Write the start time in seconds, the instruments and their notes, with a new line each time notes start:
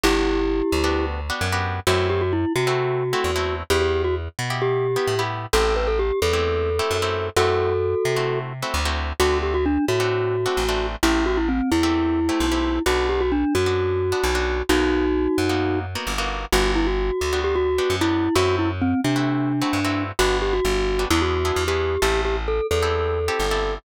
0.03 electric bass (finger) G1, acoustic guitar (steel) B3 D4 F#4 G4, glockenspiel E4 G4
0.72 electric bass (finger) D2
0.84 acoustic guitar (steel) B3 D4 F#4 G4
1.30 acoustic guitar (steel) B3 D4 F#4 G4
1.41 electric bass (finger) F#2
1.52 acoustic guitar (steel) B3 D4 F#4 G4
1.87 electric bass (finger) F#2, acoustic guitar (steel) A3 C4 E4 F#4, glockenspiel F#4
2.10 glockenspiel G4
2.21 glockenspiel F#4
2.33 glockenspiel E4
2.56 electric bass (finger) C3, glockenspiel F#4
2.67 acoustic guitar (steel) A3 C4 E4 F#4
3.13 acoustic guitar (steel) A3 C4 E4 F#4
3.24 electric bass (finger) E2
3.36 acoustic guitar (steel) A3 C4 E4 F#4
3.70 electric bass (finger) E2, acoustic guitar (steel) B3 E4 G4, glockenspiel G4
3.82 glockenspiel G4
4.04 glockenspiel F#4
4.39 electric bass (finger) B2
4.50 acoustic guitar (steel) B3 E4 G4
4.62 glockenspiel G4
4.96 acoustic guitar (steel) B3 E4 G4
5.07 electric bass (finger) A2
5.19 acoustic guitar (steel) B3 E4 G4
5.53 electric bass (finger) A1, acoustic guitar (steel) A3 C4 E4 G4, glockenspiel A4
5.76 glockenspiel B4
5.87 glockenspiel A4
5.99 glockenspiel G4
6.22 electric bass (finger) E2, glockenspiel A4
6.33 acoustic guitar (steel) A3 C4 E4 G4
6.79 acoustic guitar (steel) A3 C4 E4 G4
6.91 electric bass (finger) F#2
7.02 acoustic guitar (steel) A3 C4 E4 G4
7.36 electric bass (finger) F#2, acoustic guitar (steel) A3 C4 E4 F#4, glockenspiel F#4 A4
8.05 electric bass (finger) C3
8.16 acoustic guitar (steel) A3 C4 E4 F#4
8.62 acoustic guitar (steel) A3 C4 E4 F#4
8.74 electric bass (finger) D2
8.85 acoustic guitar (steel) A3 C4 E4 F#4
9.20 electric bass (finger) D2, acoustic guitar (steel) A3 C4 D4 F#4, glockenspiel F#4
9.43 glockenspiel G4
9.54 glockenspiel F#4
9.66 glockenspiel D4
9.88 electric bass (finger) A2, glockenspiel F#4
10.00 acoustic guitar (steel) A3 C4 D4 F#4
10.46 acoustic guitar (steel) A3 C4 D4 F#4
10.57 electric bass (finger) A1
10.69 acoustic guitar (steel) A3 C4 D4 F#4
11.03 electric bass (finger) A1, acoustic guitar (steel) A3 C4 E4 G4, glockenspiel E4
11.26 glockenspiel F#4
11.37 glockenspiel E4
11.48 glockenspiel C4
11.72 electric bass (finger) E2, glockenspiel E4
11.83 acoustic guitar (steel) A3 C4 E4 G4
12.29 acoustic guitar (steel) A3 C4 E4 G4
12.40 electric bass (finger) B1
12.52 acoustic guitar (steel) A3 C4 E4 G4
12.86 electric bass (finger) B1, acoustic guitar (steel) B3 D4 F#4, glockenspiel F#4
13.09 glockenspiel G4
13.21 glockenspiel F#4
13.32 glockenspiel D4
13.55 electric bass (finger) F#2, glockenspiel F#4
13.66 acoustic guitar (steel) B3 D4 F#4
14.12 acoustic guitar (steel) B3 D4 F#4
14.23 electric bass (finger) B1
14.35 acoustic guitar (steel) B3 D4 F#4
14.69 electric bass (finger) B1, acoustic guitar (steel) A#3 B3 D#4 F#4, glockenspiel D#4 F#4
15.38 electric bass (finger) F#2
15.49 acoustic guitar (steel) A#3 B3 D#4 F#4
15.95 acoustic guitar (steel) A#3 B3 D#4 F#4
16.07 electric bass (finger) G1
16.18 acoustic guitar (steel) A#3 B3 D#4 F#4
16.52 electric bass (finger) G1, acoustic guitar (steel) B3 D4 F#4 G4, glockenspiel F#4
16.75 glockenspiel E4
16.87 glockenspiel F#4
17.21 electric bass (finger) D2
17.33 acoustic guitar (steel) B3 D4 F#4 G4
17.44 glockenspiel G4
17.55 glockenspiel F#4
17.78 acoustic guitar (steel) B3 D4 F#4 G4
17.90 electric bass (finger) F#2
18.01 acoustic guitar (steel) B3 D4 F#4 G4, glockenspiel E4
18.35 electric bass (finger) F#2, acoustic guitar (steel) A3 C4 E4 F#4, glockenspiel F#4
18.59 glockenspiel E4
18.82 glockenspiel C4
19.04 electric bass (finger) C3, glockenspiel D4
19.16 acoustic guitar (steel) A3 C4 E4 F#4
19.62 acoustic guitar (steel) A3 C4 E4 F#4
19.73 electric bass (finger) G2
19.85 acoustic guitar (steel) A3 C4 E4 F#4
20.19 electric bass (finger) G1, acoustic guitar (steel) B3 D4 F#4 G4, glockenspiel F#4
20.42 glockenspiel G4
20.53 glockenspiel F#4
20.65 electric bass (finger) G1
20.99 acoustic guitar (steel) B3 D4 F#4 G4
21.10 electric bass (finger) E2, acoustic guitar (steel) B3 D4 E4 G#4, glockenspiel E4
21.22 glockenspiel F#4
21.45 acoustic guitar (steel) B3 D4 E4 G#4
21.56 electric bass (finger) E2
21.68 acoustic guitar (steel) B3 D4 E4 G#4, glockenspiel G4
22.02 electric bass (finger) A1, acoustic guitar (steel) C4 E4 G4 A4, glockenspiel G4
22.25 glockenspiel G4
22.48 glockenspiel A4
22.71 electric bass (finger) E2, glockenspiel A4
22.82 acoustic guitar (steel) C4 E4 G4 A4
23.28 acoustic guitar (steel) C4 E4 G4 A4
23.40 electric bass (finger) G1
23.51 acoustic guitar (steel) C4 E4 G4 A4